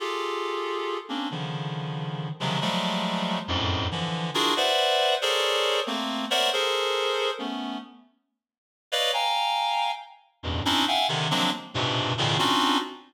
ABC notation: X:1
M:6/8
L:1/8
Q:3/8=92
K:none
V:1 name="Clarinet"
[FG_A=A]5 [_B,C_D=D] | [_D,=D,_E,F,]5 [C,_D,E,F,_G,_A,] | [F,_G,=G,_A,=A,]4 [F,,_G,,_A,,=A,,]2 | [D,E,F,]2 [DEF_G_A_B] [=Bcde_g]3 |
[_A=A_Bc_d=d]3 [A,_B,C]2 [Bc_d=de_g] | [_A=A_Bc]4 [A,=B,_D]2 | z5 [B_d=d_ef] | [fg_a_b]4 z2 |
[E,,F,,_G,,=G,,A,,B,,] [C_D=D_E=E] [ef_g=g_a] [C,D,_E,] [F,_G,_A,_B,CD] z | [G,,_A,,_B,,=B,,C,]2 [=A,,_B,,=B,,_D,_E,] [C_D=D_EF_G]2 z |]